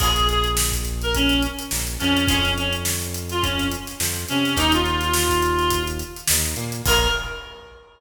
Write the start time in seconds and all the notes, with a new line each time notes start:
0.00 A#1 F4 G#4 A#4 C#5, kick, crash
0.16 closed hi-hat
0.29 G#4, closed hi-hat
0.44 closed hi-hat
0.57 snare
0.72 kick, closed hi-hat
0.85 closed hi-hat
1.02 A#4, closed hi-hat
1.15 C#4, kick, closed hi-hat
1.29 closed hi-hat
1.43 closed hi-hat
1.59 closed hi-hat
1.71 A#1 A#3, snare
1.87 closed hi-hat
2.00 F2 F3 C#4, closed hi-hat
2.17 closed hi-hat
2.27 F2 C#4 F4 G#4 C#5, kick, closed hi-hat
2.44 snare, closed hi-hat
2.58 C#4, closed hi-hat
2.73 closed hi-hat
2.85 snare
3.02 closed hi-hat
3.14 closed hi-hat
3.29 F4, snare, closed hi-hat
3.42 C#4, kick, closed hi-hat
3.59 snare, closed hi-hat
3.71 closed hi-hat
3.87 snare, closed hi-hat
4.00 F2 F3, snare
4.16 closed hi-hat
4.28 C3 C4 C#4, closed hi-hat
4.45 snare, closed hi-hat
4.56 D#2 D#4 G4 A#4, kick, closed hi-hat
4.72 F4, closed hi-hat
4.85 closed hi-hat
5.01 snare, closed hi-hat
5.13 snare
5.29 kick, closed hi-hat
5.42 closed hi-hat
5.59 closed hi-hat
5.70 kick, closed hi-hat
5.87 closed hi-hat
5.99 closed hi-hat
6.16 closed hi-hat
6.28 D#2 D#4, snare
6.45 closed hi-hat
6.56 A#2 A#3, closed hi-hat
6.72 closed hi-hat
6.86 A#1 F4 G#4 A#4 C#5, kick, crash